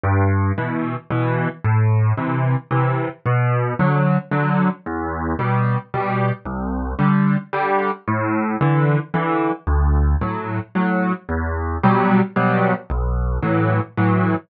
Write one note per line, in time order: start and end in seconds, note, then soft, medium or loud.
0.03 0.52 G2 medium
0.58 0.95 B2 medium
0.58 0.95 E3 medium
1.10 1.48 B2 medium
1.10 1.48 E3 medium
1.64 2.13 A2 medium
2.18 2.55 C3 medium
2.18 2.55 E3 medium
2.71 3.08 C3 medium
2.71 3.08 E3 medium
3.26 3.74 B2 medium
3.79 4.17 D3 medium
3.79 4.17 F#3 medium
4.31 4.69 D3 medium
4.31 4.69 F#3 medium
4.86 5.34 E2 medium
5.39 5.77 B2 medium
5.39 5.77 G3 medium
5.94 6.31 B2 medium
5.94 6.31 G3 medium
6.46 6.94 C2 medium
6.99 7.36 D3 medium
6.99 7.36 G3 medium
7.53 7.91 D3 medium
7.53 7.91 G3 medium
8.08 8.56 A2 medium
8.61 8.98 D3 medium
8.61 8.98 E3 medium
9.14 9.51 D3 medium
9.14 9.51 E3 medium
9.67 10.15 D2 medium
10.21 10.59 A2 medium
10.21 10.59 F#3 medium
10.75 11.13 A2 medium
10.75 11.13 F#3 medium
11.29 11.77 E2 medium
11.83 12.21 B2 medium
11.83 12.21 F#3 medium
11.83 12.21 G3 medium
12.36 12.74 B2 medium
12.36 12.74 F#3 medium
12.36 12.74 G3 medium
12.90 13.38 B1 medium
13.43 13.80 A2 medium
13.43 13.80 E3 medium
13.43 13.80 F#3 medium
13.97 14.35 A2 medium
13.97 14.35 E3 medium
13.97 14.35 F#3 medium